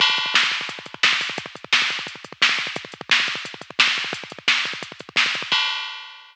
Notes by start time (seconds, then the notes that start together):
0.00 kick, crash
0.10 kick
0.17 kick, closed hi-hat
0.26 kick
0.34 kick, snare
0.43 kick
0.51 kick, closed hi-hat
0.61 kick
0.69 kick, closed hi-hat
0.79 kick
0.86 kick, closed hi-hat
0.94 kick
1.03 kick, snare
1.13 kick
1.21 kick, open hi-hat
1.30 kick
1.38 kick, closed hi-hat
1.46 kick
1.55 kick, closed hi-hat
1.64 kick
1.73 kick, snare
1.82 kick
1.90 kick, closed hi-hat
1.99 kick
2.07 kick, closed hi-hat
2.16 kick
2.24 kick, closed hi-hat
2.32 kick
2.42 kick, snare
2.49 kick
2.59 kick, closed hi-hat
2.67 kick
2.76 kick, closed hi-hat
2.85 kick
2.92 kick, closed hi-hat
3.01 kick
3.09 kick, snare
3.20 kick
3.27 kick, closed hi-hat
3.35 kick
3.45 kick, closed hi-hat
3.54 kick
3.61 kick, closed hi-hat
3.70 kick
3.79 kick, snare
3.88 kick
3.97 kick, closed hi-hat
4.04 kick
4.13 kick, closed hi-hat
4.24 kick
4.30 kick, closed hi-hat
4.39 kick
4.48 kick, snare
4.65 kick, closed hi-hat
4.73 kick
4.83 kick, closed hi-hat
4.92 kick
4.99 kick, closed hi-hat
5.09 kick
5.16 kick, snare
5.26 kick
5.34 kick, closed hi-hat
5.42 kick
5.52 kick, crash